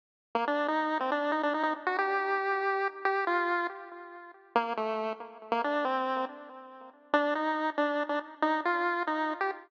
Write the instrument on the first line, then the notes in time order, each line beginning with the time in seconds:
lead 1 (square)
0.35 A#3
0.47 D4
0.68 D#4
1.00 C4
1.12 D4
1.32 D#4
1.43 D4
1.54 D#4
1.63 D#4
1.87 F#4
1.98 G4
3.05 G4
3.27 F4
4.55 A#3
4.77 A3
5.52 A#3
5.64 D4
5.85 C4
7.13 D4
7.35 D#4
7.78 D4
8.09 D4
8.42 D#4
8.65 F4
9.07 D#4
9.41 G4